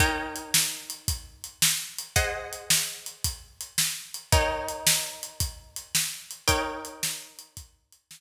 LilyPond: <<
  \new Staff \with { instrumentName = "Acoustic Guitar (steel)" } { \time 12/8 \key ees \major \tempo 4. = 111 <ees' bes' des'' g''>1. | <aes' c'' ees'' ges''>1. | <ees' bes' des'' g''>1. | <ees' bes' des'' g''>1. | }
  \new DrumStaff \with { instrumentName = "Drums" } \drummode { \time 12/8 <hh bd>4 hh8 sn4 hh8 <hh bd>4 hh8 sn4 hh8 | <hh bd>4 hh8 sn4 hh8 <hh bd>4 hh8 sn4 hh8 | <hh bd>4 hh8 sn4 hh8 <hh bd>4 hh8 sn4 hh8 | <hh bd>4 hh8 sn4 hh8 <hh bd>4 hh8 sn4. | }
>>